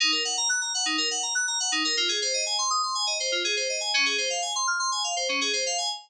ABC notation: X:1
M:4/4
L:1/16
Q:1/4=122
K:Ebdor
V:1 name="Electric Piano 2"
E B g b g' b g E B g b g' b g E B | F A c e a c' e' c' a e c F A c e a | D A c f a c' f' c' a f c D A c f a | z16 |]